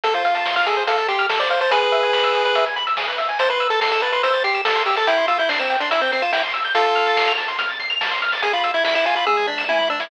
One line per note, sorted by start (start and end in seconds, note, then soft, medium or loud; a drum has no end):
0.04 0.81 F2 loud
0.04 0.13 A4 medium
0.04 0.14 A4 loud
0.04 kick medium
0.04 closed hi-hat medium
0.14 0.55 F4 medium
0.14 0.23 C5 medium
0.14 kick medium
0.14 closed hi-hat medium
0.25 0.34 F5 medium
0.25 closed hi-hat medium
0.35 0.44 A5 medium
0.35 closed hi-hat medium
0.46 0.55 C6 medium
0.46 snare medium
0.56 0.66 F4 medium
0.56 0.65 F6 medium
0.56 closed hi-hat medium
0.66 0.84 G#4 medium
0.66 0.76 A4 medium
0.66 closed hi-hat medium
0.77 0.86 C5 medium
0.77 closed hi-hat medium
0.87 1.65 F2 medium
0.87 1.07 A4 medium
0.87 0.97 F5 medium
0.87 kick medium
0.87 closed hi-hat medium
0.98 1.07 A5 medium
0.98 closed hi-hat medium
1.08 1.27 G4 medium
1.08 1.18 C6 medium
1.08 kick medium
1.08 closed hi-hat medium
1.19 1.28 F6 medium
1.19 closed hi-hat medium
1.29 1.39 A4 medium
1.29 snare loud
1.40 1.49 C5 medium
1.40 1.50 D5 medium
1.40 closed hi-hat medium
1.50 1.60 C5 medium
1.50 1.60 F5 medium
1.50 closed hi-hat medium
1.61 1.71 C5 medium
1.61 1.70 A5 medium
1.61 closed hi-hat medium
1.71 2.49 E2 loud
1.71 1.80 G#4 medium
1.71 2.65 G#4 medium
1.71 2.65 B4 medium
1.71 kick loud
1.71 closed hi-hat medium
1.82 1.91 B4 medium
1.82 kick medium
1.82 closed hi-hat medium
1.92 2.02 E5 medium
1.92 closed hi-hat medium
2.03 2.12 G#5 medium
2.03 closed hi-hat medium
2.13 2.22 B5 medium
2.13 snare medium
2.24 2.33 E6 medium
2.24 closed hi-hat medium
2.34 2.44 G#4 medium
2.34 closed hi-hat medium
2.45 2.55 B4 medium
2.45 closed hi-hat medium
2.55 2.95 E2 medium
2.55 2.65 E5 medium
2.55 kick medium
2.55 closed hi-hat medium
2.66 2.76 G#5 medium
2.66 closed hi-hat medium
2.76 2.85 B5 medium
2.76 closed hi-hat medium
2.87 2.96 E6 medium
2.87 closed hi-hat medium
2.97 3.16 G2 medium
2.97 3.07 G#4 medium
2.97 snare medium
3.08 3.17 B4 medium
3.08 closed hi-hat medium
3.18 3.37 G#2 medium
3.18 3.28 E5 medium
3.18 closed hi-hat medium
3.29 3.38 G#5 medium
3.29 closed hi-hat medium
3.39 4.17 A1 loud
3.39 3.49 C5 loud
3.39 3.49 A5 medium
3.39 kick medium
3.39 closed hi-hat medium
3.50 3.68 B4 medium
3.50 3.59 C6 medium
3.50 kick medium
3.50 closed hi-hat medium
3.60 3.70 E6 medium
3.60 closed hi-hat medium
3.70 3.80 A4 medium
3.70 3.80 A6 medium
3.70 closed hi-hat medium
3.81 3.91 A4 medium
3.81 3.90 C7 medium
3.81 snare medium
3.92 4.02 A4 medium
3.92 4.01 E7 medium
3.92 closed hi-hat medium
4.02 4.12 B4 medium
4.02 4.12 A5 medium
4.02 closed hi-hat medium
4.12 4.22 B4 medium
4.12 4.22 C6 medium
4.12 closed hi-hat medium
4.23 5.00 A1 medium
4.23 4.43 C5 medium
4.23 4.33 E6 medium
4.23 kick medium
4.23 closed hi-hat medium
4.33 4.43 A6 medium
4.33 closed hi-hat medium
4.44 4.61 G4 medium
4.44 4.54 C7 medium
4.44 kick medium
4.44 closed hi-hat medium
4.54 4.64 E7 medium
4.54 closed hi-hat medium
4.65 4.83 A4 medium
4.65 4.75 A5 medium
4.65 snare loud
4.76 4.85 C6 medium
4.76 closed hi-hat medium
4.86 4.96 G4 medium
4.86 4.96 E6 medium
4.86 closed hi-hat medium
4.96 5.07 A4 medium
4.96 5.06 A6 medium
4.96 closed hi-hat medium
5.07 5.84 C2 loud
5.07 5.26 E4 loud
5.07 5.17 G5 medium
5.07 kick medium
5.07 closed hi-hat medium
5.18 5.27 C6 medium
5.18 kick medium
5.18 closed hi-hat medium
5.28 5.38 F4 medium
5.28 5.37 E6 medium
5.28 closed hi-hat medium
5.38 5.49 E4 medium
5.38 5.48 G6 medium
5.38 closed hi-hat medium
5.49 5.59 D4 medium
5.49 5.59 C7 medium
5.49 snare medium
5.59 5.76 C4 medium
5.59 5.69 E7 medium
5.59 closed hi-hat medium
5.70 5.79 G5 medium
5.70 closed hi-hat medium
5.80 5.90 D4 medium
5.80 5.90 C6 medium
5.80 closed hi-hat medium
5.91 6.68 C2 medium
5.91 6.01 E4 medium
5.91 6.00 E6 medium
5.91 kick medium
5.91 closed hi-hat medium
6.01 6.11 C4 medium
6.01 6.11 G6 medium
6.01 closed hi-hat medium
6.12 6.23 C4 medium
6.12 6.22 C7 medium
6.12 closed hi-hat medium
6.22 6.32 F4 medium
6.22 6.32 E7 medium
6.22 closed hi-hat medium
6.33 6.42 E4 medium
6.33 6.42 G5 medium
6.33 snare medium
6.43 6.53 C6 medium
6.43 closed hi-hat soft
6.54 6.63 E6 medium
6.54 closed hi-hat medium
6.65 6.74 G6 medium
6.65 closed hi-hat medium
6.74 7.52 F2 loud
6.74 7.33 F4 medium
6.74 7.33 A4 loud
6.74 6.85 A5 loud
6.74 kick medium
6.74 closed hi-hat medium
6.85 6.95 C6 medium
6.85 kick medium
6.85 closed hi-hat medium
6.95 7.05 F6 medium
6.95 closed hi-hat medium
7.06 7.16 A6 medium
7.06 closed hi-hat medium
7.16 7.26 C7 medium
7.16 snare loud
7.28 7.37 F7 medium
7.28 closed hi-hat medium
7.38 7.47 A5 medium
7.38 closed hi-hat medium
7.48 7.58 C6 medium
7.48 closed hi-hat medium
7.59 8.36 F2 medium
7.59 7.68 F6 medium
7.59 kick medium
7.59 closed hi-hat medium
7.69 7.78 A6 medium
7.69 closed hi-hat medium
7.80 7.89 C7 medium
7.80 kick medium
7.80 closed hi-hat medium
7.90 7.99 F7 medium
7.90 closed hi-hat medium
8.01 8.10 A5 medium
8.01 snare loud
8.11 8.21 C6 medium
8.11 closed hi-hat medium
8.22 8.31 F6 medium
8.22 closed hi-hat medium
8.32 8.42 A6 medium
8.32 open hi-hat medium
8.42 9.19 E2 loud
8.42 8.53 G#4 medium
8.42 8.52 G#5 medium
8.42 kick medium
8.42 closed hi-hat medium
8.53 8.72 F4 medium
8.53 8.63 B5 medium
8.53 closed hi-hat medium
8.64 8.73 E6 medium
8.64 closed hi-hat medium
8.74 8.84 E4 medium
8.74 8.83 G#6 medium
8.74 closed hi-hat medium
8.84 8.94 E4 medium
8.84 8.94 B6 medium
8.84 snare medium
8.95 9.05 E4 medium
8.95 9.05 E7 medium
8.95 closed hi-hat medium
9.05 9.15 F4 medium
9.05 9.15 G#5 medium
9.05 closed hi-hat medium
9.15 9.25 F4 medium
9.15 9.26 B5 medium
9.15 closed hi-hat medium
9.26 9.67 E2 loud
9.26 9.47 G#4 medium
9.26 9.36 E6 medium
9.26 kick medium
9.26 high tom medium
9.37 9.47 G#6 medium
9.37 mid tom medium
9.47 9.64 D4 medium
9.47 9.57 B6 medium
9.47 floor tom medium
9.58 9.67 E7 medium
9.58 snare medium
9.69 9.87 G2 medium
9.69 9.89 E4 medium
9.69 9.78 G#5 medium
9.69 high tom medium
9.79 9.88 B5 medium
9.79 mid tom medium
9.89 10.08 G#2 medium
9.89 10.00 D4 medium
9.89 9.99 E6 medium
10.00 10.10 E4 medium
10.00 10.09 G#6 medium
10.00 snare loud